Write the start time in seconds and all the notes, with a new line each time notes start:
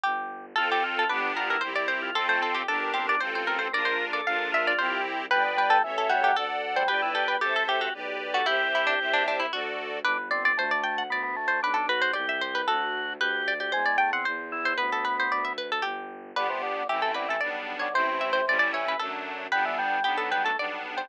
0.04 G1 G4
0.56 F2 C4 F4 A4
0.71 G4 A4
0.84 F4
0.99 A4
1.09 G1 B3 D4 G4 B4
1.36 F4 A#4
1.49 E4 A#4
1.61 C2 C4 E4 G4 C5
1.76 D5
1.88 C5
2.02 F4
2.15 F2 C4 F4 A4
2.28 A3 C5
2.42 C4 A4
2.55 G4
2.68 G1 D4 G4 A4 A#4
2.94 C4 G4
3.07 D4 D5
3.20 A1 C4 F4 A4 C5
3.35 C5
3.47 A#4
3.59 C4 C5
3.72 A#1 D4 F4 A#4 D5
3.85 C5
4.13 A4 D5
4.25 A#1 D4 F4 A#4 F5
4.52 F4 E5
4.67 D5
4.78 C2 C4 E4 G4 C5
5.30 G1 G3 B4 D5 G5
5.44 B3
5.57 G3 B4
5.70 A4
5.84 A1 E3 A4 C#5 E5
5.98 A4
6.10 G3 F#4
6.23 F#3 G4
6.36 D2 A4 D5 F#5
6.76 G3 C5
6.88 G1 G4 B4 D5 G5
7.02 E4
7.15 G4 A4
7.28 B4
7.41 A1 G4 A4 C5 E5
7.56 A4
7.68 G4
7.81 F#4 G4
7.94 B1 G4 B4 D5
8.34 F#4 A4
8.46 C2 E4 G4 C5 E5
8.75 E4
8.87 D4
8.99 C2 G4 C5 E5
9.13 D4
9.28 D4
9.40 E4
9.52 D2 F#4 A4 D5
10.04 G1 D4 B4
10.31 C4 D5
10.45 D5
10.57 D2 A3 C5
10.71 D5
10.84 G5
10.98 F#5
11.10 D2 B3 D5
11.23 B3
11.36 A3
11.48 C5
11.63 B1 D4 B4
11.74 D4 A4
11.89 F#4 B4
12.02 C5
12.13 C2 G4 D5
12.29 E5
12.41 C5
12.55 B4
12.68 D2 F#4 A4
13.21 D2 G4 B4
13.48 D5
13.60 G4 D5
13.72 E2 G#3 C5
13.86 D5
13.98 A3 G5
14.13 C4 F#5
14.25 E2 C5
14.52 E4
14.65 C5
14.78 D2 B3 B4
14.92 A4
15.05 B4
15.20 C5
15.31 D2 D5
15.45 E5
15.58 B4
15.72 A4
15.82 G1 G4
16.36 G1 D3 B3 D4 G4 B4
16.49 C3
16.63 D3
16.89 A1 E3 A3 C4 E4 G4
17.02 A4
17.14 D3 B4
17.28 E3 A4
17.41 B1 G3 B3 D4 D5
17.79 D3 C#5
17.93 A1 C3 A3 C4 E4 C5
18.21 E5
18.33 C5
18.47 A1 G3 A3 C#4 E4 D5
18.59 D5
18.73 E3 C#5
18.88 B4
18.99 F#2 F#3 A3 D4 A4
19.52 G1 G3 B3 D4 B4
19.65 E3
19.78 G3
20.04 B1 F#3 B3 D4 G4
20.18 A4
20.31 G3 B4
20.44 A3 A4
20.58 B1 G3 B3 D4 D5
20.97 G3 C5